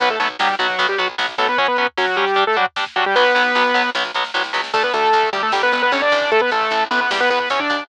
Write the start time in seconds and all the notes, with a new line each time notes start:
0.00 B1 F#3 B3 B4, kick, closed hi-hat
0.10 A3 A4, kick
0.19 B1 F#3 A3 B3 A4, kick, closed hi-hat
0.30 kick
0.39 B1 F#3 G3 B3 G4, kick, snare
0.49 kick
0.59 B1 F#3 B3 F#4, kick, closed hi-hat
0.69 kick
0.79 B1 F#3 B3, kick, closed hi-hat
0.89 G3 G4, kick
0.98 B1 F#3 B3 F#4, kick, closed hi-hat
1.09 kick
1.18 B1 F#3 B3, kick, snare
1.28 kick
1.38 B1 F#3 A3 B3 A4, kick, open hi-hat
1.48 B3 B4, kick
1.58 F#3 C#4 C#5, kick, closed hi-hat
1.68 B3 B4, kick
1.77 F#3 B3 C#4 B4, kick, closed hi-hat
1.87 kick
1.97 F#3 C#4 F#4, kick, snare
2.08 kick
2.17 F#3 G3 C#4 G4, kick, closed hi-hat
2.28 kick
2.36 G3 D4, kick, closed hi-hat
2.47 A3 A4, kick
2.56 F#3 G3 D4 F#4, kick, closed hi-hat
2.66 kick
2.76 G3 D4, kick, snare
2.86 kick
2.96 F#3 G3 D4 F#4, kick, closed hi-hat
3.06 G3 G4, kick
3.15 B1 F#3 B3 B4, kick, snare
3.35 B1 F#3 B3, snare
3.55 B1 F#3 B3, snare
3.74 B1 F#3 B3, snare
3.95 B1 F#3 B3, snare
4.04 snare
4.14 B1 F#3 B3, snare
4.24 snare
4.34 C2 F#3 B3, snare
4.44 snare
4.53 C#2 F#3 B3, snare
4.64 snare
4.74 D2 A3 A4, kick, crash
4.83 B3 B4, kick
4.93 D2 A3 A4, kick, closed hi-hat
5.04 kick
5.13 D2, kick, closed hi-hat
5.23 kick
5.33 D2 G3 G4, kick, closed hi-hat
5.43 A3 A4, kick
5.52 G1 G3 G4, kick, snare
5.62 B3 B4, kick
5.72 G1 B3 B4, kick, closed hi-hat
5.82 B3 B4, kick
5.92 G1 C#4 C#5, kick, closed hi-hat
6.02 D4 D5, kick
6.12 A1, kick, closed hi-hat
6.22 kick
6.31 A3 A4, kick, closed hi-hat
6.41 B3 B4, kick
6.51 A1 A3 A4, kick, closed hi-hat
6.61 kick
6.71 A1, kick, closed hi-hat
6.81 kick
6.91 A1 B3 B4, kick, closed hi-hat
7.01 B3 B4, kick
7.10 E2 G3 G4, kick, snare
7.20 B3 B4, kick
7.30 E2 B3 B4, kick, closed hi-hat
7.40 B3 B4, kick
7.50 E2 C#4 C#5, kick, closed hi-hat
7.60 D4 D5, kick
7.70 D#2, kick, closed hi-hat
7.80 kick